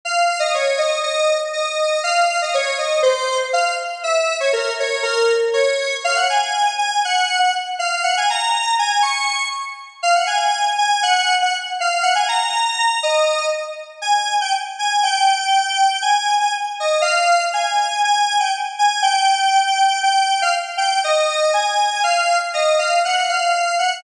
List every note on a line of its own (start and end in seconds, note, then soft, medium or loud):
0.05 0.38 F5 medium
0.40 0.51 D#5 medium
0.54 0.78 C#5 medium
0.78 0.99 D#5 medium
1.03 1.38 D#5 medium
1.53 2.01 D#5 medium
2.04 2.38 F5 medium
2.42 2.54 D#5 medium
2.54 2.76 C#5 medium
2.78 3.01 D#5 medium
3.02 3.37 C5 medium
3.53 3.74 F5 medium
4.03 4.35 E5 medium
4.40 4.52 C#5 medium
4.53 4.73 A#4 medium
4.80 5.03 C#5 medium
5.03 5.33 A#4 medium
5.53 5.94 C#5 medium
6.04 6.16 F5 medium
6.16 6.28 F#5 medium
6.30 6.72 G#5 medium
6.78 7.00 G#5 medium
7.05 7.39 F#5 medium
7.39 7.51 F#5 medium
7.79 8.02 F5 medium
8.03 8.15 F#5 medium
8.17 8.29 G#5 medium
8.30 8.73 A#5 medium
8.79 9.03 G#5 medium
9.02 9.45 C#6 medium
10.03 10.15 F5 medium
10.16 10.27 F#5 medium
10.27 10.70 G#5 medium
10.78 11.02 G#5 medium
11.03 11.34 F#5 loud
11.42 11.54 F#5 medium
11.80 12.05 F5 medium
12.03 12.15 F#5 medium
12.15 12.27 G#5 medium
12.28 12.77 A#5 medium
12.78 13.01 A#5 medium
13.03 13.45 D#5 medium
14.02 14.35 G#5 medium
14.41 14.53 G5 medium
14.79 15.02 G#5 medium
15.03 15.97 G5 medium
16.02 16.34 G#5 medium
16.40 16.52 G#5 medium
16.80 17.01 D#5 medium
17.02 17.42 F5 loud
17.54 18.02 G#5 medium
18.04 18.38 G#5 medium
18.40 18.52 G5 medium
18.79 19.01 G#5 medium
19.02 19.99 G5 loud
20.03 20.40 G5 medium
20.42 20.54 F5 medium
20.77 20.99 G5 medium
21.04 21.52 D#5 medium
21.54 22.01 G#5 medium
22.04 22.38 F5 medium
22.54 22.78 D#5 medium
22.78 22.99 F5 medium
23.05 23.14 F#5 medium
23.14 23.26 F#5 medium
23.29 23.75 F5 medium
23.79 24.01 F#5 medium